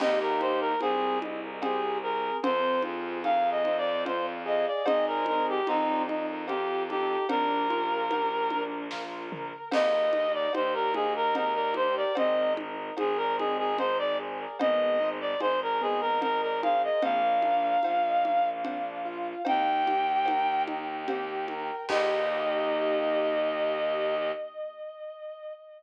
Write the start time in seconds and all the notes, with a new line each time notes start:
0.00 D#2 A#3 D#4 G4 D#5, crash, cowbell, low conga
0.21 A#4
0.41 C5, high conga
0.60 A#4
0.81 C2 C4 G#4, cowbell, high conga
1.22 E4, high conga
1.62 G4 G#4, cowbell, low conga
2.03 C4 A#4
2.42 F2 C4 C5, cowbell, low conga
2.82 F4, high conga
3.24 G#4 F5, cowbell, high conga
3.51 D#5
3.64 C4, high conga
3.78 D5
4.05 F4 C5, cowbell, low conga
4.46 G#4 D#5
4.67 D5
4.86 G#1 C4 D#4 G#4 D#5, cowbell, low conga
5.07 A#4
5.26 A#4, high conga
5.49 G4
5.67 F2 C4 D#4, cowbell, high conga
6.08 D#4, high conga
6.47 F4 G4, cowbell, low conga
6.89 G4 A4, high conga
7.28 A#1 D4 A#4, cowbell, low conga
7.70 F4, high conga
8.10 A#4, cowbell, high conga
8.50 D4, high conga
8.91 F4, kick, snare
9.32 A#4, mid tom
9.71 D#2 A#3 D#5, crash, cowbell, low conga
10.13 D#4, high conga
10.34 D5
10.53 D#2 G4 C5, cowbell, high conga
10.74 A#4
10.94 A#3 G#4, high conga
11.16 A#4
11.35 D#4 A#4, cowbell, low conga
11.55 A#4
11.74 G4 C5, high conga
11.97 D5
12.15 G#1 C4 D#5, cowbell, low conga
12.57 D#4, high conga
12.97 G#1 G#4, cowbell, high conga
13.17 A#4
13.38 C4 G#4, high conga
13.58 G#4
13.78 D#4 C5, cowbell, low conga
13.98 D5
14.19 G#4
14.59 G#1 B3 D#5, cowbell, low conga
15.00 D#4
15.21 D5
15.40 G#1 G#4 C5, cowbell, high conga
15.62 A#4
15.81 B3 G#4
16.01 A#4
16.21 D#4 A#4, cowbell, low conga
16.42 A#4
16.63 G#4 F5, high conga
16.84 D#5
17.02 A#1 A#3 F5, cowbell, low conga
17.42 D4, high conga
17.83 A#1 F4, cowbell, high conga
18.25 A#3, high conga
18.65 D4, cowbell, low conga
19.05 F4
19.45 D#2 D#4 G5, cowbell, low conga
19.86 G4, high conga
20.26 A#4, cowbell, high conga
20.68 D#4, high conga
21.08 G4, cowbell, low conga
21.48 A#4, high conga
21.89 D#2 A#3 D#4 G4 D#5, kick, crash